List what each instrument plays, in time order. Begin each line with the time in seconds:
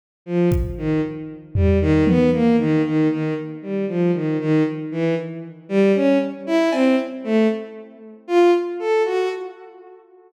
0.26 violin F3
0.52 kick
0.78 violin D#3
1.55 violin G3, floor tom
1.81 violin D#3
2.07 violin B3, high tom
2.33 violin A#3
2.59 violin D#3
2.84 violin D#3
3.10 violin D#3
3.62 violin G3
3.88 violin F3
4.14 violin D#3
4.40 violin D#3
4.91 violin E3
5.69 violin G3
5.95 violin C#4
6.47 violin E4
6.72 violin C4, cowbell
7.24 violin A3
8.28 violin F4
8.79 violin A4
9.05 violin F#4